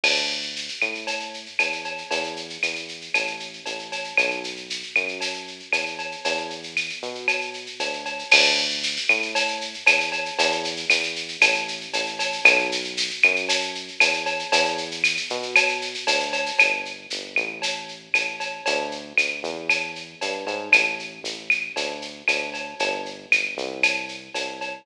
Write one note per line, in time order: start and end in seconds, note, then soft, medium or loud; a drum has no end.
0.03 0.69 D2 medium
0.03 crash loud
0.03 cowbell medium
0.03 claves medium
0.16 shaker medium
0.30 shaker medium
0.42 shaker medium
0.56 shaker loud
0.68 shaker medium
0.81 1.48 A2 medium
0.81 claves medium
0.81 shaker medium
0.95 shaker medium
1.07 cowbell medium
1.07 shaker loud
1.20 shaker medium
1.34 shaker medium
1.46 shaker medium
1.59 2.03 E2 medium
1.59 cowbell medium
1.59 claves medium
1.59 shaker loud
1.72 shaker medium
1.84 cowbell medium
1.84 shaker medium
1.98 shaker medium
2.11 2.58 E2 medium
2.11 cowbell medium
2.11 shaker loud
2.24 shaker medium
2.36 shaker medium
2.50 shaker medium
2.63 3.09 E2 medium
2.63 claves medium
2.63 shaker loud
2.75 shaker medium
2.88 shaker medium
3.01 shaker medium
3.14 3.61 A1 medium
3.14 cowbell medium
3.14 claves medium
3.14 shaker loud
3.27 shaker medium
3.40 shaker medium
3.53 shaker medium
3.66 4.13 A1 medium
3.66 cowbell medium
3.66 shaker medium
3.79 shaker medium
3.92 cowbell medium
3.92 shaker medium
4.04 shaker medium
4.17 4.84 B1 medium
4.17 cowbell medium
4.17 claves loud
4.17 shaker loud
4.30 shaker medium
4.44 shaker medium
4.57 shaker medium
4.70 shaker loud
4.83 shaker medium
4.96 5.62 F#2 medium
4.96 claves medium
4.96 shaker medium
5.08 shaker medium
5.21 cowbell medium
5.21 shaker loud
5.34 shaker medium
5.47 shaker medium
5.60 shaker medium
5.72 6.16 E2 medium
5.72 cowbell medium
5.72 claves medium
5.72 shaker loud
5.86 shaker medium
5.99 cowbell medium
5.99 shaker medium
6.12 shaker medium
6.25 6.91 E2 medium
6.25 cowbell loud
6.25 shaker loud
6.37 shaker medium
6.50 shaker medium
6.63 shaker medium
6.77 claves medium
6.77 shaker loud
6.89 shaker medium
7.02 7.68 B2 medium
7.02 shaker medium
7.15 shaker medium
7.28 cowbell medium
7.28 claves medium
7.28 shaker loud
7.41 shaker medium
7.54 shaker medium
7.66 shaker medium
7.80 8.24 D2 medium
7.80 cowbell medium
7.80 shaker loud
7.93 shaker medium
8.05 cowbell medium
8.05 shaker medium
8.19 shaker medium
8.31 8.98 D2 loud
8.31 crash loud
8.31 cowbell loud
8.31 claves loud
8.44 shaker loud
8.58 shaker medium
8.70 shaker medium
8.83 shaker loud
8.96 shaker loud
9.09 9.75 A2 medium
9.09 claves loud
9.09 shaker medium
9.22 shaker medium
9.35 cowbell loud
9.35 shaker loud
9.48 shaker medium
9.61 shaker medium
9.74 shaker medium
9.86 10.31 E2 medium
9.86 cowbell loud
9.86 claves loud
9.86 shaker loud
10.00 shaker loud
10.12 cowbell loud
10.12 shaker medium
10.26 shaker medium
10.39 10.85 E2 loud
10.39 cowbell loud
10.39 shaker loud
10.52 shaker medium
10.64 shaker loud
10.77 shaker loud
10.90 11.37 E2 medium
10.90 claves loud
10.90 shaker loud
11.03 shaker loud
11.16 shaker loud
11.28 shaker medium
11.41 11.87 A1 loud
11.41 cowbell loud
11.41 claves loud
11.41 shaker loud
11.54 shaker medium
11.68 shaker loud
11.81 shaker medium
11.93 12.40 A1 medium
11.93 cowbell medium
11.93 shaker loud
12.06 shaker medium
12.19 cowbell loud
12.19 shaker loud
12.32 shaker medium
12.45 13.11 B1 loud
12.45 cowbell loud
12.45 claves loud
12.45 shaker loud
12.59 shaker medium
12.72 shaker loud
12.84 shaker medium
12.97 shaker loud
13.10 shaker medium
13.22 13.90 F#2 medium
13.22 claves loud
13.22 shaker medium
13.36 shaker medium
13.49 cowbell medium
13.49 shaker loud
13.61 shaker medium
13.75 shaker medium
13.88 shaker medium
14.00 14.45 E2 medium
14.00 cowbell loud
14.00 claves loud
14.00 shaker loud
14.13 shaker medium
14.26 cowbell loud
14.26 shaker medium
14.39 shaker medium
14.52 15.18 E2 loud
14.52 cowbell loud
14.52 shaker loud
14.65 shaker medium
14.78 shaker loud
14.91 shaker loud
15.04 claves loud
15.04 shaker loud
15.17 shaker loud
15.30 15.96 B2 medium
15.30 shaker loud
15.43 shaker medium
15.55 cowbell loud
15.55 claves loud
15.55 shaker loud
15.68 shaker medium
15.82 shaker loud
15.94 shaker loud
16.07 16.51 D2 medium
16.07 cowbell loud
16.07 shaker loud
16.20 shaker medium
16.33 cowbell loud
16.33 shaker loud
16.46 shaker loud
16.59 17.07 G1 medium
16.59 cowbell loud
16.59 claves loud
16.59 shaker loud
16.85 shaker medium
17.10 17.35 G1 medium
17.10 shaker loud
17.36 18.08 A1 medium
17.36 claves medium
17.36 shaker medium
17.62 cowbell medium
17.62 shaker loud
17.89 shaker medium
18.14 18.61 A1 medium
18.14 cowbell medium
18.14 claves loud
18.14 shaker loud
18.40 cowbell medium
18.40 shaker medium
18.66 19.13 D2 loud
18.66 cowbell loud
18.66 shaker loud
18.91 shaker medium
19.17 19.42 D2 medium
19.17 claves loud
19.17 shaker loud
19.43 20.15 E2 medium
19.43 shaker medium
19.69 cowbell medium
19.69 claves medium
19.69 shaker loud
19.95 shaker medium
20.21 20.45 G2 medium
20.21 cowbell medium
20.21 shaker loud
20.46 20.70 G#2 medium
20.46 cowbell medium
20.46 shaker medium
20.72 21.20 A1 medium
20.72 cowbell medium
20.72 claves loud
20.72 shaker loud
20.99 shaker medium
21.24 21.70 A1 medium
21.24 shaker loud
21.50 claves loud
21.50 shaker medium
21.76 22.23 D2 medium
21.76 cowbell medium
21.76 shaker loud
22.02 shaker medium
22.28 22.74 D2 medium
22.28 cowbell medium
22.28 claves medium
22.28 shaker loud
22.54 cowbell medium
22.54 shaker medium
22.79 23.26 G1 loud
22.79 cowbell loud
22.79 shaker loud
23.06 shaker medium
23.32 23.56 G1 medium
23.32 claves loud
23.32 shaker loud
23.57 24.29 C2 loud
23.57 shaker medium
23.83 cowbell medium
23.83 claves loud
23.83 shaker loud
24.09 shaker medium
24.34 24.81 C2 medium
24.34 cowbell medium
24.34 shaker loud
24.61 cowbell medium
24.61 shaker medium